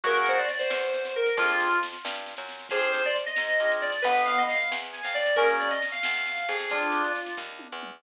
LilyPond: <<
  \new Staff \with { instrumentName = "Electric Piano 2" } { \time 6/8 \key f \dorian \tempo 4. = 90 bes'16 bes'16 c''16 d''16 d''16 c''4~ c''16 bes'8 | f'4 r2 | aes'16 r16 c''16 d''16 r16 ees''4~ ees''16 d''8 | b'8 f''16 ees''16 f''8 r8 aes''16 f''16 d''8 |
bes'16 r16 d''16 ees''16 r16 f''4~ f''16 aes'8 | f'4. r4. | }
  \new Staff \with { instrumentName = "Drawbar Organ" } { \time 6/8 \key f \dorian ges'4 r2 | f'4 r2 | c''4 r2 | b4 r2 |
des'4 r2 | d'4 r2 | }
  \new Staff \with { instrumentName = "Drawbar Organ" } { \time 6/8 \key f \dorian <bes des' ges' aes'>2. | <c' d' f' aes'>2. | <c' d' f' aes'>2 <c' d' f' aes'>4 | r2. |
<bes des' ges' aes'>2. | <c' d' f' aes'>2. | }
  \new Staff \with { instrumentName = "Electric Bass (finger)" } { \clef bass \time 6/8 \key f \dorian ges,4. e,4. | f,4. g,8. ges,8. | f,4. aes,4. | g,,4. e,8. f,8. |
ges,4. e,4 f,8~ | f,4. ees,8. e,8. | }
  \new DrumStaff \with { instrumentName = "Drums" } \drummode { \time 6/8 <bd sn>16 sn16 sn16 sn16 sn16 sn16 sn16 sn16 sn16 sn8 sn16 | <bd sn>16 sn16 sn16 sn16 sn16 sn16 sn16 sn16 sn16 sn16 sn16 sn16 | <bd sn>16 sn16 sn16 sn16 sn16 sn16 sn16 sn16 sn16 sn16 sn16 sn16 | <bd sn>16 sn16 sn16 sn16 sn16 sn16 sn16 sn16 sn16 sn16 sn16 sn16 |
<bd sn>16 sn16 sn16 sn16 sn16 sn16 sn16 sn16 sn16 sn16 sn16 sn16 | <bd sn>16 sn16 sn16 sn16 sn16 sn16 <bd sn>8 tommh8 toml8 | }
>>